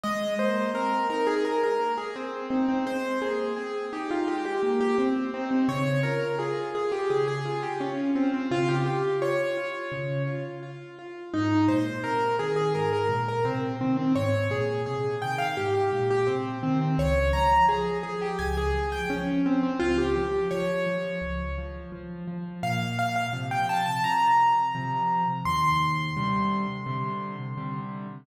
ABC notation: X:1
M:4/4
L:1/16
Q:1/4=85
K:Ab
V:1 name="Acoustic Grand Piano"
e2 c2 B2 B A B B2 A C2 C C | c2 A2 A2 G F G G2 G C2 C C | d2 B2 A2 A G A A2 G D2 C C | F G G2 d6 z6 |
E2 c2 B2 A A B B2 B C2 C C | d2 A2 A2 g f G G2 G C2 C C | d2 b2 A2 A G a A2 g D2 C C | F G G2 d6 z6 |
[K:Bb] f2 f f z g a a b8 | c'16 |]
V:2 name="Acoustic Grand Piano"
A,2 B,2 C2 E2 A,2 B,2 z2 E2 | A,2 B,2 C2 E2 A,2 B,2 z2 E2 | D,2 F2 F2 F2 D,2 F2 F2 F2 | D,2 F2 F2 F2 D,2 F2 F2 F2 |
A,,2 B,,2 C,2 E,2 A,,2 B,,2 C,2 E,2 | A,,2 B,,2 C,2 E,2 A,,2 B,,2 C,2 E,2 | D,,2 F,2 F,2 F,2 D,,2 F,2 F,2 F,2 | D,,2 F,2 F,2 F,2 D,,2 F,2 F,2 F,2 |
[K:Bb] B,,4 [C,F,]4 [C,F,]4 [C,F,]4 | E,,4 [C,D,G,]4 [C,D,G,]4 [C,D,G,]4 |]